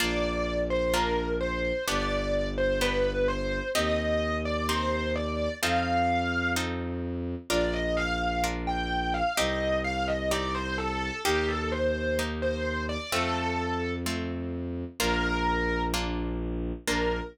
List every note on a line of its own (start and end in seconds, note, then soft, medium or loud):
0.00 1.72 A#1 medium
0.00 0.84 A#3 medium
0.00 0.84 D4 loud
0.00 0.84 F4 loud
0.00 0.61 D5 loud
0.70 0.93 C5 loud
0.94 1.78 A#3 medium
0.94 1.78 D4 medium
0.94 1.78 F4 medium
0.94 1.33 A#4 loud
1.41 1.85 C5 medium
1.88 3.61 G1 medium
1.88 2.72 B3 loud
1.88 2.72 D4 loud
1.88 2.72 G4 loud
1.88 2.48 D5 loud
2.58 2.80 C5 loud
2.81 3.66 B3 medium
2.81 3.66 D4 medium
2.81 3.66 G4 medium
2.81 3.25 B4 loud
3.28 3.68 C5 loud
3.75 5.48 D#2 medium
3.75 4.59 C4 loud
3.75 4.59 D#4 loud
3.75 4.59 G4 loud
3.75 4.36 D#5 loud
4.45 4.68 D5 loud
4.69 5.53 C4 medium
4.69 5.53 D#4 medium
4.69 5.53 G4 medium
4.69 5.13 C5 loud
5.16 5.54 D5 loud
5.62 7.35 F2 loud
5.62 6.47 C4 loud
5.62 6.47 D#4 loud
5.62 6.47 F4 loud
5.62 6.47 A4 loud
5.62 6.51 F5 loud
6.56 7.41 C4 medium
6.56 7.41 D#4 medium
6.56 7.41 F4 medium
6.56 7.41 A4 loud
7.49 9.22 A#1 medium
7.49 8.34 D4 loud
7.49 8.34 F4 loud
7.49 8.34 A#4 loud
7.49 7.72 D5 loud
7.73 7.96 D#5 loud
7.97 8.41 F5 loud
8.44 9.28 D4 medium
8.44 9.28 F4 medium
8.44 9.28 A#4 loud
8.67 9.13 G5 loud
9.14 9.36 F5 loud
9.37 11.11 C2 medium
9.37 10.22 C4 loud
9.37 10.22 D#4 loud
9.37 10.22 G4 loud
9.37 9.77 D#5 loud
9.84 10.07 F5 loud
10.08 10.30 D#5 loud
10.31 11.16 C4 medium
10.31 11.16 D#4 medium
10.31 11.16 G4 medium
10.31 10.54 D5 loud
10.55 10.77 C5 loud
10.78 11.21 A4 loud
11.25 12.97 D#2 medium
11.25 12.09 A#3 loud
11.25 12.09 D#4 loud
11.25 11.47 G4 loud
11.25 12.09 G4 loud
11.48 11.71 A4 loud
11.72 12.17 C5 loud
12.19 13.03 A#3 medium
12.19 13.03 D#4 medium
12.19 13.03 G4 medium
12.42 12.83 C5 loud
12.89 13.11 D5 loud
13.12 14.84 F2 medium
13.12 13.97 A3 medium
13.12 13.97 C4 loud
13.12 13.97 F4 loud
13.12 13.91 A4 loud
14.06 14.91 A3 medium
14.06 14.91 C4 medium
14.06 14.91 F4 medium
15.00 16.72 A#1 loud
15.00 15.84 A#3 loud
15.00 15.84 D4 loud
15.00 15.84 F4 loud
15.00 15.82 A#4 loud
15.94 16.78 A#3 loud
15.94 16.78 D4 medium
15.94 16.78 F4 loud
16.88 17.21 A#1 medium
16.88 17.20 A#3 loud
16.88 17.20 D4 loud
16.88 17.20 F4 loud
16.88 17.20 A#4 loud